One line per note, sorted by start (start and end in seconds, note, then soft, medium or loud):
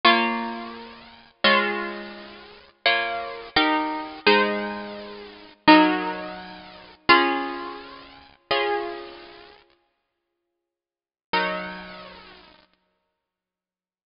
0.05 1.32 A#3 loud
0.05 1.32 F4 loud
0.05 1.32 C#5 loud
1.44 2.71 G#3 loud
1.44 2.71 F4 loud
1.44 2.71 C#5 loud
2.86 3.49 A#3 loud
2.86 3.49 F4 loud
2.86 3.49 C#5 loud
3.56 4.20 D#4 medium
3.56 4.20 G4 loud
3.56 4.20 A#4 loud
4.27 5.54 G#3 loud
4.27 5.54 D#4 loud
4.27 5.54 C5 loud
5.68 6.95 F#3 medium
5.68 6.95 D#4 loud
5.68 6.95 A#4 loud
7.09 8.36 C#4 loud
7.09 8.36 F4 loud
7.09 8.36 G#4 loud
8.51 11.27 C#4 medium
8.51 11.27 F4 medium
8.51 11.27 G#4 medium
11.33 14.10 F#3 medium
11.33 14.10 D#4 medium
11.33 14.10 A#4 medium